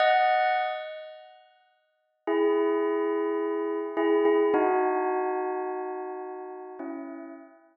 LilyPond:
\new Staff { \time 4/4 \key e \major \tempo 4 = 53 <dis'' fis''>8 r4. <e' gis'>4. <e' gis'>16 <e' gis'>16 | <dis' fis'>2 <cis' e'>8 r4. | }